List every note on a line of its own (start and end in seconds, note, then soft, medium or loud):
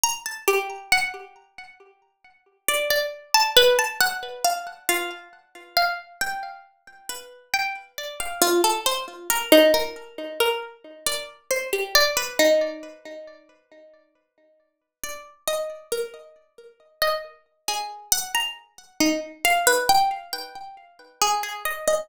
0.03 0.23 A#5 loud
0.26 0.46 A5 medium
0.48 0.87 G4 medium
0.92 1.72 F#5 loud
2.68 2.88 D5 loud
2.90 3.30 D5 medium
3.34 3.54 A5 loud
3.56 3.76 B4 loud
3.79 3.99 A5 medium
4.01 4.40 F#5 loud
4.44 4.64 F5 medium
4.89 5.28 F4 medium
5.77 6.16 F5 medium
6.21 7.01 G5 medium
7.09 7.49 B4 medium
7.54 7.74 G5 medium
7.98 8.18 D5 medium
8.20 8.40 F5 medium
8.42 8.61 F4 loud
8.64 8.84 A4 medium
8.86 9.06 C5 medium
9.30 9.50 A#4 loud
9.52 9.72 D#4 loud
9.74 10.33 A#4 medium
10.40 10.60 A#4 medium
11.06 11.26 D5 medium
11.51 11.70 C5 medium
11.73 11.93 G4 medium
11.95 12.15 D5 loud
12.17 12.37 B4 medium
12.39 13.19 D#4 medium
15.03 15.23 D5 medium
15.47 15.87 D#5 medium
15.92 16.12 A#4 soft
17.02 17.22 D#5 medium
17.68 18.08 G#4 medium
18.12 18.32 F#5 loud
18.35 18.54 A#5 medium
19.00 19.20 D#4 medium
19.45 19.65 F5 loud
19.67 19.87 B4 loud
19.89 20.09 G5 medium
20.33 21.12 G5 soft
21.22 21.41 G#4 medium
21.43 21.63 G#4 medium
21.65 21.85 D#5 medium
21.88 22.07 D#5 medium